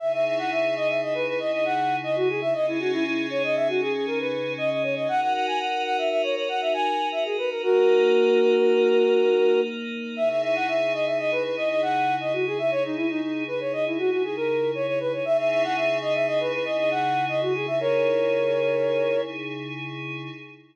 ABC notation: X:1
M:5/4
L:1/16
Q:1/4=118
K:C#dor
V:1 name="Flute"
e e e f e2 d e d B B d d f3 d F G e | d E F E E2 c d e F G G A B3 d d c d | f f f g f2 f e e c c f e g3 e G B A | [FA]16 z4 |
e e e f e2 d e d B B d d f3 d F G e | c D E D D2 B c d E F F G A3 c c B c | e e e f e2 d e d B B d d f3 d F G e | [Ac]12 z8 |]
V:2 name="Pad 5 (bowed)"
[C,DEG]20 | [C,CDG]20 | [DFA]20 | [A,DA]20 |
[C,DEG]20- | [C,DEG]20 | [C,DEG]20- | [C,DEG]20 |]